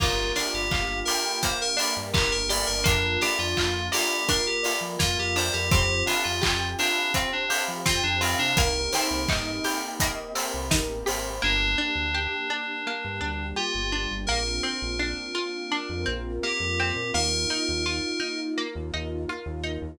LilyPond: <<
  \new Staff \with { instrumentName = "Electric Piano 2" } { \time 4/4 \key g \minor \tempo 4 = 84 f'8 bes'16 g'8. bes'8 c''16 bes'8 r16 g'16 bes'16 d''16 bes'16 | d'8 g'16 f'8. g'8 bes'16 g'8 r16 f'16 g'16 c''16 g'16 | g'8 d'16 f'8. d'8 c'16 d'8 r16 f'16 d'16 c'16 d'16 | bes'2 r2 |
d'2. f'4 | bes'2. g'4 | bes'2 r2 | }
  \new Staff \with { instrumentName = "Electric Piano 1" } { \time 4/4 \key g \minor bes'8 d''8 f''8 g''8 f''8 d''8 bes'8 d''8 | bes'8 d''8 f''8 d''8 bes'8 d''8 f''8 d''8 | c''8 f''8 g''8 f''8 c''8 f''8 g''8 f''8 | bes'8 c''8 ees''8 g''8 ees''8 c''8 bes'8 c''8 |
bes8 d'8 g'8 d'8 bes8 d'8 g'8 d'8 | bes8 c'8 d'8 f'8 d'8 c'8 bes8 c'8 | bes8 ees'8 f'8 ees'8 bes8 ees'8 f'8 ees'8 | }
  \new Staff \with { instrumentName = "Pizzicato Strings" } { \time 4/4 \key g \minor bes8 d'8 f'8 g'8 bes8 d'8 f'8 g'8 | bes8 d'8 f'8 bes8 d'8 f'8 bes8 d'8 | c'8 f'8 g'8 c'8 f'8 g'8 c'8 f'8 | bes8 c'8 ees'8 g'8 bes8 c'8 ees'8 g'8 |
bes8 d'8 g'8 d'8 bes8 d'8 g'8 d'8 | bes8 c'8 d'8 f'8 d'8 c'8 bes8 c'8 | bes8 ees'8 f'8 ees'8 bes8 ees'8 f'8 ees'8 | }
  \new Staff \with { instrumentName = "Synth Bass 1" } { \clef bass \time 4/4 \key g \minor g,,8. g,,16 g,,4.~ g,,16 g,16 g,,16 g,,8 g,,16 | f,8. f,16 f,4.~ f,16 f16 f,16 f,8 f,16 | f,8. f,16 f,4.~ f,16 f16 f,16 f,8 c16 | c,8. c,16 g,4.~ g,16 c,16 a,,8 aes,,8 |
g,,8. d,4. g,16 d,8. g,,8 g,,16 | bes,,8. bes,,4. f,16 bes,,8. f,8 bes,16 | ees,8. ees,4. ees,16 ees,8. ees,8 ees,16 | }
  \new Staff \with { instrumentName = "Pad 2 (warm)" } { \time 4/4 \key g \minor <bes d' f' g'>2 <bes d' g' bes'>2 | <bes d' f'>2 <bes f' bes'>2 | <c' f' g'>2 <c' g' c''>2 | <bes c' ees' g'>2 <bes c' g' bes'>2 |
<bes d' g'>2 <g bes g'>2 | <bes c' d' f'>2 <bes c' f' bes'>2 | <bes ees' f'>2 <bes f' bes'>2 | }
  \new DrumStaff \with { instrumentName = "Drums" } \drummode { \time 4/4 <cymc bd>8 <hho sn>8 <hc bd>8 hho8 <hh bd>8 hho8 <hc bd>8 hho8 | <hh bd>8 <hho sn>8 <hc bd>8 hho8 <hh bd>8 hho8 <bd sn>8 hho8 | <hh bd>8 <hho sn>8 <hc bd>8 hho8 <hh bd>8 hho8 <bd sn>8 hho8 | <hh bd>8 <hho sn>8 <hc bd>8 hho8 <hh bd>8 hho8 <bd sn>8 hho8 |
r4 r4 r4 r4 | r4 r4 r4 r4 | r4 r4 r4 r4 | }
>>